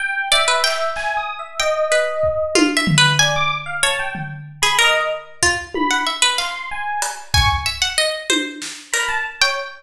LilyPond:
<<
  \new Staff \with { instrumentName = "Harpsichord" } { \time 5/8 \tempo 4 = 94 r8 d''16 b'16 g''4. | g''8 b'4 \tuplet 3/2 { f'8 e''8 b'8 } | gis''4 cis''8 r8. gis'16 | ais'4 f'8. fis''16 e''16 b'16 |
f''4. gis''8 e''16 fis''16 | dis''8 c''4 ais'8. g''16 | }
  \new Staff \with { instrumentName = "Electric Piano 1" } { \time 5/8 g''8 e''4 \tuplet 3/2 { gis''8 dis'''8 e''8 } | dis''4. r4 | d''16 d'''16 r16 f''16 a''16 g''16 r8. b''16 | dis''8 r4 b''8 r8 |
c'''8 gis''8 r8 cis'''16 r8. | r4. b''16 a''16 r16 cis''16 | }
  \new DrumStaff \with { instrumentName = "Drums" } \drummode { \time 5/8 r4 hc8 hc4 | r4 bd8 tommh8 tomfh8 | r4. tomfh4 | r4 bd8 tommh4 |
hc4 hh8 bd4 | r8 tommh8 sn8 hh4 | }
>>